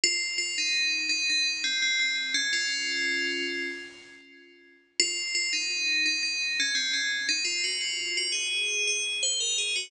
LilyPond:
\new Staff { \time 7/8 \key des \major \tempo 4 = 85 f'16 r16 f'16 ees'8. ees'16 ees'16 r16 c'16 c'16 c'16 r16 des'16 | <des' f'>4. r2 | f'16 r16 f'16 ees'8. ees'16 ees'16 r16 des'16 c'16 des'16 r16 ees'16 | f'16 ges'16 f'8 ges'16 aes'8. aes'16 r16 c''16 bes'16 aes'16 ges'16 | }